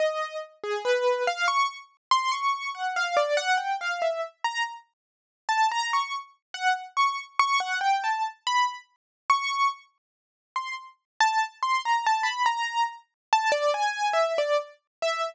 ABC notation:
X:1
M:9/8
L:1/16
Q:3/8=47
K:none
V:1 name="Acoustic Grand Piano"
^d2 z ^G B2 f ^c' z2 =c' ^c'2 ^f =f =d ^f =g | f e z ^a z4 =a ^a ^c' z2 ^f z c' z c' | ^f g a z b z3 ^c'2 z4 =c' z2 a | z c' ^a =a b ^a2 z2 =a d ^g2 e d z2 e |]